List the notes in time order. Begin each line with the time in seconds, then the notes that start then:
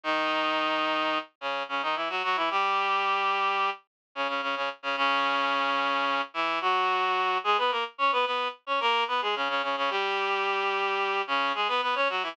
0.04 D#3 D#4
1.41 C#3 C#4
1.69 C#3 C#4
1.82 D#3 D#4
1.96 E3 E4
2.09 F#3 F#4
2.23 F#3 F#4
2.36 E3 E4
2.50 G3 G4
4.15 C#3 C#4
4.28 C#3 C#4
4.42 C#3 C#4
4.56 C#3 C#4
4.83 C#3 C#4
4.97 C#3 C#4
6.34 E3 E4
6.61 F#3 F#4
7.44 G#3 G#4
7.58 B3 B4
7.71 A#3 A#4
7.98 C#4 C#5
8.12 B3 B4
8.26 B3 B4
8.67 C#4 C#5
8.80 A#3 A#4
9.08 B3 B4
9.22 G#3 G#4
9.36 C#3 C#4
9.49 C#3 C#4
9.63 C#3 C#4
9.77 C#3 C#4
9.90 G3 G4
11.27 C#3 C#4
11.55 G#3 G#4
11.68 B3 B4
11.82 B3 B4
11.95 C#4 C#5
12.09 F#3 F#4
12.23 E3 E4